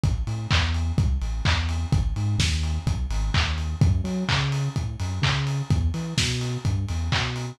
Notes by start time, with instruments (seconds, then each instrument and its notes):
0.04 synth bass 2 A1, kick, closed hi-hat
0.27 synth bass 2 A2, open hi-hat
0.51 synth bass 2 E2, kick, clap
0.74 open hi-hat
0.98 synth bass 2 C2, kick, closed hi-hat
1.22 synth bass 2 A1, open hi-hat
1.45 synth bass 2 E2, kick, clap
1.69 open hi-hat
1.92 synth bass 2 G#1, kick, closed hi-hat
2.16 synth bass 2 G#2, open hi-hat
2.38 synth bass 2 D#2, kick, snare
2.63 open hi-hat
2.86 synth bass 2 B1, kick, closed hi-hat
3.10 synth bass 2 G#1, open hi-hat
3.34 synth bass 2 D#2, kick, clap
3.58 open hi-hat
3.81 synth bass 2 F#2, kick, closed hi-hat
4.04 synth bass 2 F#3, open hi-hat
4.29 synth bass 2 C#3, kick, clap
4.52 open hi-hat
4.76 synth bass 2 A2, kick, closed hi-hat
5.00 synth bass 2 F#2, open hi-hat
5.22 synth bass 2 C#3, kick, clap
5.47 open hi-hat
5.70 synth bass 2 E2, kick, closed hi-hat
5.94 synth bass 2 E3, open hi-hat
6.17 synth bass 2 B2, kick, snare
6.41 open hi-hat
6.65 synth bass 2 G2, kick, closed hi-hat
6.89 synth bass 2 E2, open hi-hat
7.12 synth bass 2 B2, kick, clap
7.36 open hi-hat